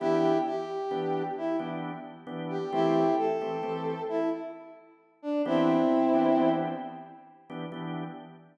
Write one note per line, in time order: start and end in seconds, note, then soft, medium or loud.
0.00 0.33 E3 loud
0.00 0.33 B3 medium
0.00 0.33 D4 medium
0.00 0.38 E4 medium
0.00 0.38 G4 loud
0.00 0.33 G4 loud
0.46 1.23 G4 medium
0.91 1.23 E3 medium
0.91 1.23 B3 medium
0.91 1.23 D4 medium
0.91 1.23 G4 medium
1.38 1.57 E4 medium
1.59 1.91 E3 medium
1.59 1.91 B3 medium
1.59 1.91 D4 medium
1.59 1.91 G4 medium
2.27 2.59 E3 medium
2.27 2.59 B3 medium
2.27 2.59 D4 medium
2.27 2.59 G4 medium
2.50 2.71 G4 medium
2.73 3.04 E3 loud
2.73 3.04 A3 loud
2.73 3.04 C4 loud
2.73 3.15 E4 medium
2.73 3.04 G4 loud
2.73 3.15 G4 medium
3.18 4.03 A4 medium
3.41 3.57 E3 medium
3.41 3.57 A3 medium
3.41 3.57 C4 medium
3.41 3.57 G4 medium
3.63 3.95 E3 medium
3.63 3.95 A3 medium
3.63 3.95 C4 medium
3.63 3.95 G4 medium
4.09 4.30 E4 medium
5.22 5.42 D4 medium
5.46 5.77 E3 loud
5.46 5.77 B3 loud
5.46 6.50 C4 medium
5.46 5.77 D4 loud
5.46 6.50 E4 medium
5.46 5.77 G4 loud
6.14 6.30 E3 medium
6.14 6.30 B3 medium
6.14 6.30 D4 medium
6.14 6.30 G4 medium
6.36 6.68 E3 medium
6.36 6.68 B3 medium
6.36 6.68 D4 medium
6.36 6.68 G4 medium
7.50 7.66 E3 medium
7.50 7.66 B3 medium
7.50 7.66 D4 medium
7.50 7.66 G4 medium
7.72 8.04 E3 medium
7.72 8.04 B3 medium
7.72 8.04 D4 medium
7.72 8.04 G4 medium